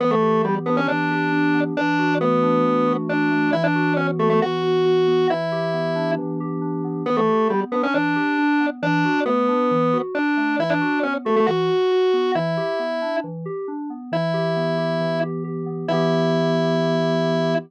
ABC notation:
X:1
M:4/4
L:1/16
Q:1/4=136
K:Edor
V:1 name="Drawbar Organ"
B, A,3 G, z B, C D8 | D4 B,8 D4 | E D3 C z A, A, F8 | E8 z8 |
B, A,3 G, z B, C D8 | D4 B,8 D4 | E D3 C z A, A, F8 | E8 z8 |
E10 z6 | E16 |]
V:2 name="Electric Piano 2"
E,2 G2 B,2 D2 E,2 G2 D2 B,2 | E,2 F2 A,2 D2 E,2 F2 D2 A,2 | E,2 F2 B,2 F2 E,2 F2 F2 B,2 | E,2 G2 B,2 D2 E,2 G2 D2 B,2 |
E,2 G2 B,2 D2 E,2 G2 D2 B,2 | E,2 F2 A,2 D2 E,2 F2 D2 A,2 | E,2 F2 B,2 F2 E,2 F2 F2 B,2 | E,2 G2 B,2 D2 E,2 G2 D2 B,2 |
E,2 G2 B,2 G2 E,2 G2 G2 B,2 | [E,B,G]16 |]